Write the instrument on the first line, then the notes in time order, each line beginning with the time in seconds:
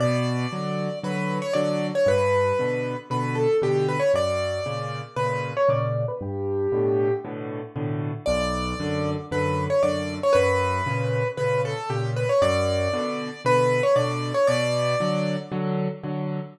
acoustic grand piano
0.00 B2 D5
0.52 D3 F#3
1.03 D3 F#3 B4
1.42 C#5
1.53 D3 F#3 D5
1.95 C#5
2.06 G2 B4
2.59 B2 D3
3.10 B2 D3 B4
3.35 A4
3.62 B2 D3 G4
3.88 B4
4.00 C#5
4.14 F#2 D5
4.66 A#2 C#3
5.16 A#2 C#3 B4
5.57 C#5
5.69 A#2 C#3 D5
6.08 B4
6.21 G2 G4
6.72 A2 B2 D3
7.24 A2 B2 D3
7.76 A2 B2 D3
8.26 B1 D5
8.80 F#2 D3
9.31 F#2 D3 B4
9.70 C#5
9.83 F#2 D3 D5
10.23 C#5
10.33 F#2 B4
10.86 A#2 C#3
11.37 A#2 C#3 B4
11.65 A4
11.89 A#2 C#3 G4
12.16 B4
12.29 C#5
12.42 F#2 D5
12.93 B2 D3
13.45 B2 D3 B4
13.83 C#5
13.96 B2 D3 D5
14.34 C#5
14.47 B2 D5
15.00 D3 F#3
15.52 D3 F#3
16.03 D3 F#3